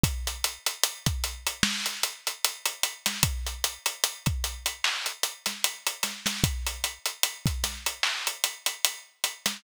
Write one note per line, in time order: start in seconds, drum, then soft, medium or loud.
0.04 kick loud
0.04 closed hi-hat loud
0.27 closed hi-hat medium
0.44 closed hi-hat medium
0.66 closed hi-hat medium
0.84 closed hi-hat loud
1.06 kick medium
1.06 closed hi-hat medium
1.24 closed hi-hat medium
1.47 closed hi-hat medium
1.63 snare loud
1.86 closed hi-hat medium
2.03 closed hi-hat medium
2.27 closed hi-hat medium
2.45 closed hi-hat medium
2.66 closed hi-hat medium
2.83 closed hi-hat medium
3.06 snare medium
3.06 closed hi-hat medium
3.23 kick loud
3.23 closed hi-hat loud
3.47 closed hi-hat medium
3.64 closed hi-hat medium
3.86 closed hi-hat medium
4.04 closed hi-hat medium
4.26 kick medium
4.26 closed hi-hat medium
4.44 closed hi-hat medium
4.66 closed hi-hat medium
4.84 clap loud
5.06 closed hi-hat medium
5.23 closed hi-hat medium
5.46 snare soft
5.46 closed hi-hat medium
5.64 closed hi-hat medium
5.87 closed hi-hat medium
6.03 snare soft
6.03 closed hi-hat medium
6.26 snare medium
6.26 closed hi-hat medium
6.44 kick loud
6.44 closed hi-hat loud
6.67 closed hi-hat medium
6.84 closed hi-hat medium
7.06 closed hi-hat medium
7.23 closed hi-hat loud
7.46 kick medium
7.46 closed hi-hat medium
7.64 snare soft
7.64 closed hi-hat medium
7.86 closed hi-hat medium
8.03 clap loud
8.27 closed hi-hat medium
8.44 closed hi-hat medium
8.66 closed hi-hat medium
8.85 closed hi-hat loud
9.24 closed hi-hat medium
9.46 snare medium
9.46 closed hi-hat medium